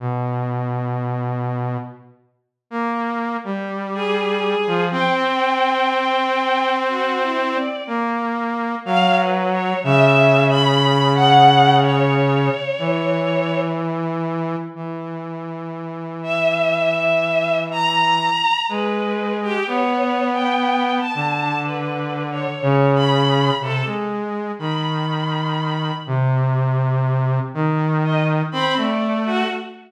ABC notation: X:1
M:5/4
L:1/16
Q:1/4=61
K:none
V:1 name="Lead 2 (sawtooth)"
B,,8 z3 ^A,3 G,5 F, | C12 ^A,4 ^F,4 | ^C,12 E,8 | E,16 ^G,4 |
B,6 D,6 ^C,4 =C, ^G,3 | ^D,6 C,6 D,4 C A,3 |]
V:2 name="Violin"
z16 ^G4 | g8 (3^F2 E2 d2 z4 (3=f2 B2 ^c2 | (3e4 b4 ^f4 ^c8 z4 | z6 e6 ^a4 B3 G |
(3^c4 g4 a4 (3B4 c4 b4 A z3 | b6 z8 ^d z b =d2 ^F |]